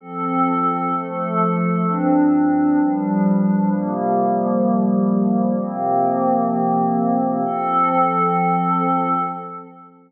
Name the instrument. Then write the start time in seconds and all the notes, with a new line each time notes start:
pad 5 (bowed)
0.00 F3 C4 A4
0.93 F3 A3 A4
1.86 G2 F3 C4 D4
2.79 G2 F3 G3 D4
3.71 C3 F3 G3 A#3
5.58 C3 F3 A#3 C4
7.45 F3 C4 A4